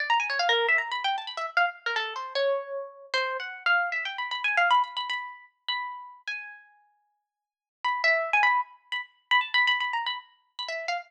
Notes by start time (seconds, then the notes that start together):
0.00 D5
0.10 A#5
0.20 G#5
0.30 C#5
0.39 F5
0.49 A#4
0.69 E5
0.78 A#5
0.92 B5
1.04 G5
1.18 A5
1.27 B5
1.37 E5
1.57 F5
1.86 A#4
1.96 A4
2.16 C5
2.35 C#5
3.14 C5
3.40 F#5
3.66 F5
3.92 E5
4.05 G5
4.18 B5
4.31 B5
4.44 G#5
4.57 F5
4.71 B5
4.84 B5
4.97 B5
5.10 B5
5.68 B5
6.28 G#5
7.84 B5
8.04 E5
8.33 G#5
8.43 B5
8.92 B5
9.31 B5
9.41 A5
9.54 B5
9.67 B5
9.80 B5
9.93 A#5
10.06 B5
10.59 B5
10.68 E5
10.88 F5